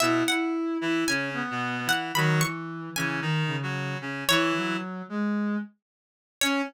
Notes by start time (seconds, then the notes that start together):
0.00 B2 B3 E4 E5
0.28 E4 F#5
0.81 E3 E4
1.07 C#3 C#4 G#5
1.34 B3
1.50 B2 B3
1.86 E3 E4 F#5
2.14 D#3 F#3 F#4 B5
2.39 E3 C#6
2.96 C#3 E3 C#4 G#5
3.21 D#3 D#4
3.47 C#3
3.62 F#3 F#4
4.01 C#3 C#4
4.28 E3 E4 C#5
4.57 F#3
5.09 G#3
6.41 C#4 C#5